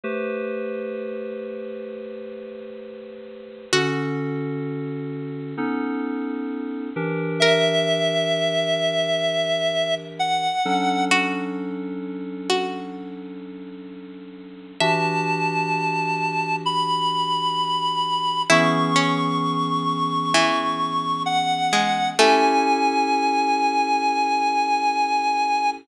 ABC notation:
X:1
M:4/4
L:1/8
Q:1/4=65
K:Dmix
V:1 name="Clarinet"
z8 | z8 | e6 f2 | z8 |
a4 b4 | [K:Emix] c'6 f2 | g8 |]
V:2 name="Pizzicato Strings"
z8 | F8 | _B8 | F3 F3 z2 |
e4 z4 | [K:Emix] E C3 E,3 G, | A,8 |]
V:3 name="Electric Piano 2"
[A,GBc]8 | [D,^CFA]4 [B,C^DA]3 [E,=DG_B]- | [E,DG_B]7 [F,^CDA]- | [F,^CDA]8 |
[E,DFG]8 | [K:Emix] [E,B,CG]8 | [CE=GA]8 |]